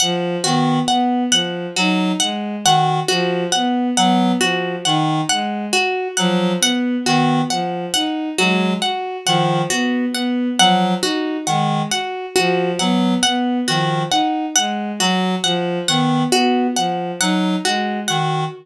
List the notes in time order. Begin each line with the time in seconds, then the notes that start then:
0.00 F3 F#5
0.44 D#3 B3 F#4
0.88 B3 F#5
1.31 F3 F#5
1.76 F#3 D#4 F#4
2.20 G#3 F#5
2.65 D#3 F#4 F#5
3.08 F3 F#4
3.52 B3 F#5
3.97 F#3 B3 F#5
4.40 F3 F#4
4.85 D#3 D#4 F#5
5.29 G#3 F#5
5.73 F#4
6.17 F3 F#3 F#5
6.60 B3 F#5
7.04 D#3 B3 F#4
7.50 F3 F#5
7.94 D#4 F#5
8.38 F#3 G#3 F#4
8.82 F#4 F#5
9.25 D#3 F3 F#5
9.70 B3 F#4
10.13 B3 F#5
10.58 F3 F#3 F#5
11.02 D#4 F#4
11.47 D#3 G#3 F#5
11.90 F#4 F#5
12.36 F3 F#4
12.79 F#3 B3 F#5
13.23 B3 F#5
13.67 D#3 F3 F#4
14.10 D#4 F#5
14.56 G#3 F#5
15.00 F#3 F#4
15.43 F3 F#5
15.88 D#3 B3 F#5
16.32 B3 F#4
16.76 F3 F#5
17.20 F#3 D#4 F#5
17.64 G#3 F#4
18.08 D#3 F#4 F#5